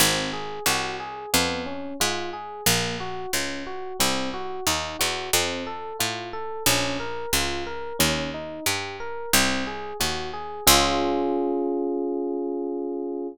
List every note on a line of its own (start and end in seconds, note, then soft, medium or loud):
0.00 0.60 G#1 medium
0.00 0.30 C4 medium
0.33 0.63 G#4 medium
0.66 1.26 C2 medium
0.66 0.97 F#4 medium
1.00 1.30 G#4 medium
1.33 1.94 F2 medium
1.33 1.63 B3 medium
1.66 1.96 C#4 medium
2.00 2.61 G#2 medium
2.00 2.30 F4 medium
2.33 2.63 G#4 medium
2.66 3.26 A#1 medium
2.66 2.96 A#3 medium
3.00 3.30 F#4 medium
3.33 3.93 C#2 medium
3.33 3.63 C#4 medium
3.67 3.97 F#4 medium
4.00 4.60 C2 medium
4.00 4.30 C4 medium
4.34 4.64 F#4 medium
4.67 4.97 D#2 medium
4.67 4.97 D#4 medium
4.99 5.31 E2 medium
4.99 5.29 F#4 medium
5.33 5.93 F2 medium
5.33 5.64 C4 medium
5.67 5.97 A4 medium
5.99 6.60 A2 medium
5.99 6.29 F4 medium
6.33 6.63 A4 medium
6.66 7.26 A#1 medium
6.66 6.97 C#4 medium
7.00 7.30 A#4 medium
7.33 7.93 C#2 medium
7.33 7.64 F4 medium
7.67 7.97 A#4 medium
7.99 8.60 D#2 medium
7.99 8.29 C#4 medium
8.34 8.64 D#4 medium
8.66 9.26 G2 medium
8.66 8.97 G4 medium
9.00 9.30 A#4 medium
9.33 9.93 C2 medium
9.33 9.64 C4 medium
9.67 9.97 G#4 medium
10.00 10.61 D#2 medium
10.00 10.30 F#4 medium
10.33 10.63 G#4 medium
10.67 13.28 C#2 loud
10.67 13.27 C#4 loud
10.67 13.27 F4 loud
10.67 13.27 G#4 loud